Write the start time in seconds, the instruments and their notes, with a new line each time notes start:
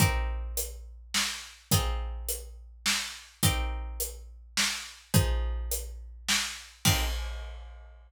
0.00 pizzicato strings C4 D#4 G4 A#4, kick, closed hi-hat
0.57 closed hi-hat
1.14 snare
1.71 pizzicato strings C4 D#4 F4 G#4, kick, closed hi-hat
2.29 closed hi-hat
2.86 snare
3.43 pizzicato strings C4 D#4 G4 A#4, kick, closed hi-hat
4.00 closed hi-hat
4.57 snare
5.14 pizzicato strings F3 D#4 G#4 C5, kick, closed hi-hat
5.71 closed hi-hat
6.29 snare
6.85 pizzicato strings C4 D#4 G4 A#4, kick, crash